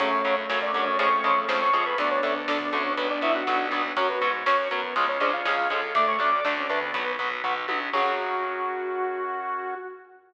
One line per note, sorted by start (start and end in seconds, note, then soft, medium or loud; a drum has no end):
0.00 0.21 F#2 medium
0.00 0.10 C#3 loud
0.00 0.10 F#3 loud
0.00 1.64 A3 loud
0.00 0.36 C#4 medium
0.00 0.98 C#4 medium
0.00 1.64 C#4 loud
0.00 0.98 F#4 medium
0.00 0.36 C#5 medium
0.00 kick loud
0.00 closed hi-hat loud
0.12 kick loud
0.24 0.46 F#2 medium
0.24 0.35 C#3 medium
0.24 0.35 F#3 medium
0.24 kick loud
0.24 closed hi-hat medium
0.37 kick loud
0.49 0.71 F#2 medium
0.49 0.59 C#3 loud
0.49 0.59 F#3 medium
0.49 kick loud
0.49 snare loud
0.62 0.86 D4 medium
0.62 0.86 D5 medium
0.62 kick loud
0.74 0.96 F#2 medium
0.74 0.84 C#3 medium
0.74 0.84 F#3 loud
0.74 kick medium
0.74 closed hi-hat medium
0.87 0.99 C#4 medium
0.87 0.99 C#5 medium
0.87 kick loud
0.99 1.20 F2 loud
0.99 1.09 C#3 loud
0.99 1.09 F3 loud
0.99 1.09 G#3 loud
0.99 1.97 C#4 medium
0.99 1.97 F4 medium
0.99 1.97 G#4 medium
0.99 1.41 C#5 medium
0.99 1.41 C#6 medium
0.99 kick loud
0.99 closed hi-hat loud
1.12 kick loud
1.24 1.45 F2 medium
1.24 1.34 C#3 loud
1.24 1.34 F3 medium
1.24 1.34 G#3 loud
1.24 kick loud
1.24 closed hi-hat medium
1.36 kick medium
1.48 1.69 F2 medium
1.48 1.59 C#3 medium
1.48 1.59 F3 medium
1.48 1.59 G#3 medium
1.48 kick loud
1.48 snare loud
1.61 1.85 C#5 medium
1.61 1.85 C#6 medium
1.61 kick medium
1.73 1.94 F2 medium
1.73 1.83 C#3 loud
1.73 1.83 F3 loud
1.73 1.83 G#3 medium
1.73 kick medium
1.73 closed hi-hat loud
1.86 1.98 B4 medium
1.86 1.98 B5 medium
1.86 kick loud
1.98 2.19 D2 medium
1.98 2.08 D3 loud
1.98 2.08 A3 loud
1.98 3.90 B3 loud
1.98 3.90 D4 loud
1.98 2.96 D4 medium
1.98 2.10 D4 medium
1.98 2.96 A4 medium
1.98 2.10 D5 medium
1.98 kick loud
1.98 closed hi-hat loud
2.11 2.34 C#4 medium
2.11 2.34 C#5 medium
2.11 kick loud
2.23 2.45 D2 medium
2.23 2.33 D3 medium
2.23 2.33 A3 medium
2.23 kick medium
2.23 closed hi-hat loud
2.36 kick loud
2.48 2.69 D2 medium
2.48 2.58 D3 medium
2.48 2.58 A3 loud
2.48 2.68 D4 medium
2.48 2.68 D5 medium
2.48 kick loud
2.48 snare loud
2.60 kick loud
2.73 2.94 D2 medium
2.73 2.83 D3 loud
2.73 2.83 A3 medium
2.73 2.93 C#4 medium
2.73 2.93 C#5 medium
2.73 kick medium
2.73 closed hi-hat medium
2.85 kick loud
2.97 3.18 B1 medium
2.97 3.07 F#3 loud
2.97 3.07 B3 loud
2.97 3.96 F#4 medium
2.97 3.96 B4 medium
2.97 kick loud
2.97 closed hi-hat loud
3.10 3.22 D4 medium
3.10 3.22 D5 medium
3.10 kick medium
3.21 3.42 B1 medium
3.21 3.32 F#3 medium
3.21 3.32 B3 medium
3.21 3.34 E4 medium
3.21 3.34 E5 medium
3.21 kick medium
3.21 closed hi-hat medium
3.35 3.68 F#4 medium
3.35 3.68 F#5 medium
3.35 kick medium
3.47 3.69 B1 medium
3.47 3.57 F#3 medium
3.47 3.57 B3 medium
3.47 kick loud
3.47 snare loud
3.60 kick medium
3.71 3.92 B1 medium
3.71 3.82 F#3 medium
3.71 3.82 B3 medium
3.71 kick loud
3.71 closed hi-hat medium
3.84 kick medium
3.97 4.18 F#2 loud
3.97 4.07 F#3 loud
3.97 4.07 C#4 loud
3.97 4.08 C#4 medium
3.97 4.08 F#4 loud
3.97 4.95 F#4 medium
3.97 4.08 C#5 medium
3.97 4.95 C#5 medium
3.97 kick loud
3.97 closed hi-hat loud
4.09 4.30 B3 medium
4.09 4.21 F#4 loud
4.09 4.30 B4 medium
4.09 kick medium
4.21 4.43 G#2 medium
4.21 4.32 F#3 loud
4.21 4.32 C#4 medium
4.21 kick loud
4.21 closed hi-hat medium
4.34 kick medium
4.46 4.67 F#2 medium
4.46 4.56 F#3 medium
4.46 4.56 C#4 medium
4.46 4.68 C#4 medium
4.46 4.68 C#5 medium
4.46 kick loud
4.46 snare loud
4.59 kick medium
4.71 4.93 F#2 medium
4.71 4.81 F#3 loud
4.71 4.95 B3 medium
4.71 4.81 C#4 medium
4.71 4.95 B4 medium
4.71 kick medium
4.71 closed hi-hat loud
4.83 kick loud
4.96 5.17 C#2 loud
4.96 5.06 F3 loud
4.96 5.06 G#3 loud
4.96 5.06 C#4 loud
4.96 5.94 F4 medium
4.96 5.94 G#4 medium
4.96 5.94 C#5 medium
4.96 kick loud
4.96 closed hi-hat loud
5.08 5.20 C#4 medium
5.08 5.20 C#5 medium
5.08 kick loud
5.20 5.41 C#2 medium
5.20 5.31 F3 medium
5.20 5.31 G#3 medium
5.20 5.31 C#4 medium
5.20 5.33 D4 medium
5.20 5.32 G#4 loud
5.20 5.33 D5 medium
5.20 kick loud
5.20 closed hi-hat medium
5.33 5.69 F4 medium
5.33 5.69 F5 medium
5.33 kick medium
5.45 5.67 C#2 medium
5.45 5.55 F3 medium
5.45 5.55 G#3 medium
5.45 5.55 C#4 loud
5.45 5.68 G#4 loud
5.45 kick loud
5.45 snare loud
5.58 kick medium
5.70 5.92 C#2 medium
5.70 5.80 F3 loud
5.70 5.80 G#3 medium
5.70 5.80 C#4 loud
5.70 5.92 A4 loud
5.70 kick loud
5.70 closed hi-hat medium
5.83 kick medium
5.95 6.16 D2 loud
5.95 6.16 A3 loud
5.95 6.05 A3 loud
5.95 6.05 D4 loud
5.95 6.93 A4 medium
5.95 6.93 D5 medium
5.95 6.07 D5 medium
5.95 6.07 D6 medium
5.95 kick loud
5.95 closed hi-hat loud
6.07 6.19 C#5 medium
6.07 6.19 C#6 medium
6.07 kick medium
6.19 6.40 D2 medium
6.19 6.30 A3 medium
6.19 6.32 C#4 loud
6.19 6.30 D4 loud
6.19 6.32 D5 medium
6.19 6.32 D6 medium
6.19 kick loud
6.19 closed hi-hat medium
6.32 6.44 D5 medium
6.32 6.44 D6 medium
6.32 kick loud
6.45 6.67 D2 medium
6.45 6.55 A3 medium
6.45 6.55 D4 medium
6.45 6.65 D4 medium
6.45 6.65 D5 medium
6.45 kick loud
6.45 snare loud
6.57 6.68 C#4 loud
6.57 kick loud
6.69 6.91 D2 medium
6.69 6.79 A3 medium
6.69 7.12 B3 medium
6.69 6.79 D4 medium
6.69 6.93 D4 loud
6.69 7.12 B4 medium
6.69 kick loud
6.69 closed hi-hat medium
6.82 kick loud
6.94 7.15 B1 loud
6.94 7.04 F#3 loud
6.94 7.04 B3 loud
6.94 7.92 F#4 medium
6.94 7.92 B4 medium
6.94 kick loud
6.94 closed hi-hat loud
7.07 kick medium
7.19 7.41 B1 medium
7.19 7.29 F#3 medium
7.19 7.29 B3 medium
7.19 kick loud
7.19 closed hi-hat medium
7.31 kick loud
7.44 7.65 B1 medium
7.44 7.54 F#3 medium
7.44 7.54 B3 medium
7.44 kick loud
7.44 floor tom medium
7.68 7.89 B1 medium
7.68 7.79 F#3 medium
7.68 7.79 B3 medium
7.68 high tom loud
7.93 9.74 F#2 loud
7.93 9.74 C#3 loud
7.93 9.74 F#3 loud
7.93 9.74 C#4 loud
7.93 9.74 F#4 loud
7.93 9.75 F#4 loud
7.93 kick loud
7.93 crash loud